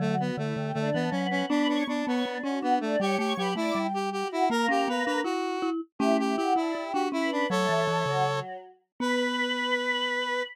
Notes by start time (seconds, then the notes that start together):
0.00 D3 F#3 A3 F#4 F#5
0.19 B3 F#4 F#5
0.38 D3 A3 E4 E5
0.56 D3 G4 G5
0.74 D3 A3 D4 D5
0.94 E3 B3
1.11 F#3 B3 C#4 B4
1.30 C#4
1.49 B3 D4 B4 B5
1.68 D4 C#5 C#6
1.87 B3 D4 A4 A5
2.06 B3 C#5 C#6
2.25 B3 D4 D5
2.43 C#4 F#4 F#5
2.62 B3 D4
2.81 A3 D4 D5
3.00 G3 G4 C#5 C#6
3.18 A3 G4 C#5 C#6
3.37 F#3 G4 B4 B5
3.56 A3 E4 D5 D6
3.75 G3 G4 G5
3.94 G4
4.12 F#4 G4 F#5
4.32 E4
4.50 A#3 A#4
4.69 C#4 G4
4.88 B3 B4
5.06 D4 B4
5.24 E4 F#4
5.62 E4
5.99 A3 C#4 E4 G4 E5
6.19 E4 G4 E5
6.37 E4 F#4 G4 F#5
6.56 D4 E4 D5
6.75 E4 G4 G5
6.93 D4 F#4
7.12 C#4 E4 B4 B5
7.32 D4
7.50 F#3 A3 A4 C#5
7.69 E3
7.88 E3 A3 A4
8.06 C#3 F#3 F#4
8.25 F#3 F#4
9.00 B3 B4